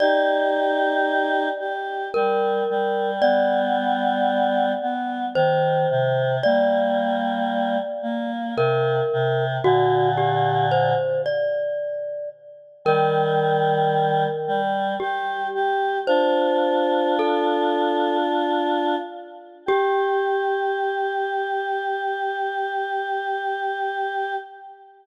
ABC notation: X:1
M:3/4
L:1/8
Q:1/4=56
K:Gm
V:1 name="Glockenspiel"
d4 B2 | d4 c2 | d4 B2 | ^F G c d2 z |
B4 G2 | "^rit." c2 A2 z2 | G6 |]
V:2 name="Choir Aahs"
[EG]3 G G, G, | [G,=B,]3 B, E, C, | [G,B,]3 B, C, C, | [B,,D,]3 z3 |
[E,G,]3 G, G G | "^rit." [DF]6 | G6 |]